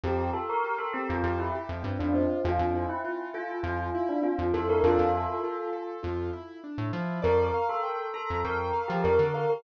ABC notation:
X:1
M:4/4
L:1/16
Q:1/4=100
K:F
V:1 name="Tubular Bells"
G2 A B2 A G F G E z3 D C2 | F3 E3 F2 F3 D F2 A B | [FA]8 z8 | B3 A3 A2 B3 G B2 B B |]
V:2 name="Acoustic Grand Piano"
C2 F2 G2 C2 F2 G2 C2 F2 | C2 E2 F2 A2 F2 E2 C2 E2 | D2 E2 F2 A2 F2 E2 D2 E2 | d2 f2 g2 b2 g2 f2 d2 f2 |]
V:3 name="Synth Bass 1" clef=bass
F,,7 F,, F,,3 F,, G,, F,,3 | F,, F,,7 F,,5 F,, F,,2 | F,, F,,7 F,,5 A,, F,2 | F,,7 F,, F,,3 F, F,, D,3 |]